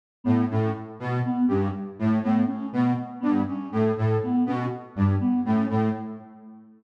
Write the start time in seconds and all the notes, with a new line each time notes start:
0.24 A2 B3
0.50 A2 C#4
1.00 B2
1.26 B3
1.48 G2 C#4
1.99 A2
2.23 A2 B3
2.47 C#4
2.73 B2
3.20 G2 B3
3.48 C#4
3.72 A2
3.97 A2
4.23 B3
4.46 B2 C#4
4.96 G2
5.20 B3
5.45 A2 C#4
5.70 A2